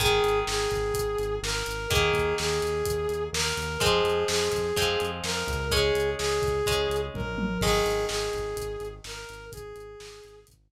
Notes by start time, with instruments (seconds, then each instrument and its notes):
0.00 synth bass 1 G#1, acoustic guitar (steel) D#3 G#3, brass section G#4, kick, closed hi-hat
0.23 synth bass 1 G#1, closed hi-hat
0.47 synth bass 1 G#1, brass section G#4, snare
0.71 synth bass 1 G#1, kick, closed hi-hat
0.94 synth bass 1 G#1, kick, closed hi-hat
1.18 synth bass 1 G#1, closed hi-hat
1.43 synth bass 1 G#1, brass section A#4, snare
1.66 synth bass 1 G#1, closed hi-hat
1.90 synth bass 1 D#2, acoustic guitar (steel) D#3 A#3, brass section G#4, kick, closed hi-hat
2.13 synth bass 1 D#2, kick, closed hi-hat
2.38 synth bass 1 D#2, brass section G#4, snare
2.62 synth bass 1 D#2, closed hi-hat
2.86 synth bass 1 D#2, kick, closed hi-hat
3.09 synth bass 1 D#2, closed hi-hat
3.33 synth bass 1 D#2, brass section A#4, snare
3.57 synth bass 1 D#2, closed hi-hat
3.80 synth bass 1 F2, acoustic guitar (steel) F3 G#3 C4, brass section G#4, kick, closed hi-hat
4.04 synth bass 1 F2, closed hi-hat
4.28 synth bass 1 F2, brass section G#4, snare
4.52 synth bass 1 F2, kick, closed hi-hat
4.76 synth bass 1 F2, acoustic guitar (steel) F3 G#3 C4, kick, closed hi-hat
5.00 synth bass 1 F2, closed hi-hat
5.24 synth bass 1 F2, brass section A#4, snare
5.47 synth bass 1 C#2, kick, closed hi-hat
5.71 acoustic guitar (steel) G#3 C#4, brass section G#4, kick, closed hi-hat
5.95 synth bass 1 C#2, closed hi-hat
6.18 synth bass 1 C#2, brass section G#4, snare
6.42 synth bass 1 C#2, kick, closed hi-hat
6.66 synth bass 1 C#2, acoustic guitar (steel) G#3 C#4, kick, closed hi-hat
6.90 synth bass 1 C#2, closed hi-hat
7.14 synth bass 1 A#1, brass section A#4, kick, high tom
7.37 synth bass 1 A1, high tom
7.61 synth bass 1 G#1, acoustic guitar (steel) D#3 G#3, brass section G#4, kick, crash
7.85 synth bass 1 G#1, closed hi-hat
8.09 synth bass 1 G#1, brass section G#4, snare
8.33 synth bass 1 G#1, kick, closed hi-hat
8.57 synth bass 1 G#1, kick, closed hi-hat
8.80 synth bass 1 G#1, closed hi-hat
9.04 synth bass 1 G#1, brass section A#4, snare
9.29 synth bass 1 G#1, closed hi-hat
9.52 synth bass 1 G#1, brass section G#4, kick, closed hi-hat
9.76 synth bass 1 G#1, closed hi-hat
10.00 synth bass 1 G#1, snare
10.24 synth bass 1 G#1, closed hi-hat
10.47 synth bass 1 G#1, kick, closed hi-hat
10.71 synth bass 1 G#1